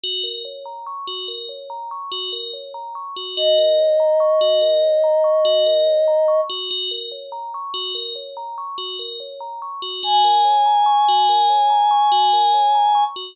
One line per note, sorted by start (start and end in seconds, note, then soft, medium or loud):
0.03 0.22 F#4 loud
0.24 0.42 A#4 medium
0.45 0.64 C#5 medium
0.65 0.84 A#5 medium
0.86 1.05 C#6 medium
1.07 1.26 F#4 medium
1.28 1.47 A#4 medium
1.49 1.68 C#5 medium
1.70 1.89 A#5 medium
1.91 2.10 C#6 medium
2.12 2.30 F#4 medium
2.32 2.51 A#4 medium
2.53 2.72 C#5 medium
2.74 2.93 A#5 medium
2.95 3.14 C#6 medium
3.16 3.35 F#4 medium
3.37 3.56 F#4 loud
3.37 6.41 D#5 medium
3.58 3.77 A#4 medium
3.79 3.97 C#5 medium
4.00 4.19 A#5 medium
4.20 4.39 C#6 loud
4.41 4.60 F#4 medium
4.62 4.80 A#4 medium
4.83 5.02 C#5 medium
5.04 5.22 A#5 medium
5.24 5.43 C#6 medium
5.45 5.64 F#4 loud
5.66 5.85 A#4 medium
5.87 6.06 C#5 loud
6.08 6.26 A#5 medium
6.28 6.47 C#6 medium
6.49 6.68 F#4 medium
6.71 6.89 F#4 loud
6.91 7.10 A#4 medium
7.12 7.30 C#5 medium
7.32 7.51 A#5 medium
7.54 7.73 C#6 medium
7.74 7.93 F#4 loud
7.95 8.14 A#4 loud
8.15 8.34 C#5 medium
8.37 8.56 A#5 medium
8.58 8.77 C#6 medium
8.78 8.97 F#4 medium
8.99 9.18 A#4 medium
9.20 9.39 C#5 medium
9.40 9.59 A#5 medium
9.62 9.81 C#6 medium
9.82 10.01 F#4 medium
10.03 10.22 F#4 loud
10.03 13.04 G#5 medium
10.24 10.43 A#4 medium
10.45 10.63 C#5 medium
10.66 10.85 A#5 medium
10.86 11.05 C#6 medium
11.09 11.27 F#4 medium
11.29 11.48 A#4 medium
11.49 11.68 C#5 medium
11.70 11.89 A#5 medium
11.91 12.10 C#6 medium
12.12 12.30 F#4 medium
12.33 12.52 A#4 medium
12.54 12.73 C#5 medium
12.75 12.94 A#5 medium
12.95 13.14 C#6 medium
13.16 13.35 F#4 medium